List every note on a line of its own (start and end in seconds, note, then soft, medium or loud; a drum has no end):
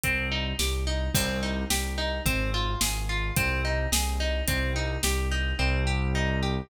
0.04 0.54 C2 medium
0.04 0.29 C4 loud
0.04 kick medium
0.04 closed hi-hat medium
0.32 0.57 D#4 medium
0.59 1.09 C2 medium
0.59 0.84 G4 medium
0.59 snare medium
0.87 1.12 D#4 medium
1.14 1.65 C2 loud
1.14 1.40 C4 loud
1.14 kick loud
1.14 crash medium
1.43 1.68 D#4 medium
1.70 2.20 C2 medium
1.70 1.95 G4 medium
1.70 snare medium
1.98 2.23 D#4 medium
2.26 2.76 G#1 medium
2.26 2.51 C4 loud
2.26 kick medium
2.26 closed hi-hat medium
2.54 2.79 F4 loud
2.81 3.31 G#1 medium
2.81 3.06 G#4 medium
2.81 snare loud
3.09 3.34 F4 medium
3.36 3.87 C2 medium
3.36 3.62 C4 loud
3.36 kick loud
3.36 closed hi-hat medium
3.65 3.90 D#4 medium
3.92 4.42 C2 medium
3.92 4.17 G#4 medium
3.92 snare loud
4.20 4.45 D#4 medium
4.48 4.98 C2 medium
4.48 4.73 C4 loud
4.48 kick medium
4.48 closed hi-hat medium
4.76 5.01 D#4 medium
5.03 5.54 C2 medium
5.03 5.29 G4 medium
5.03 snare medium
5.31 5.56 D#4 medium
5.59 6.61 C2 loud
5.59 5.84 C4 loud
5.87 6.12 G4 medium
6.15 6.40 D#4 loud
6.43 6.68 G4 medium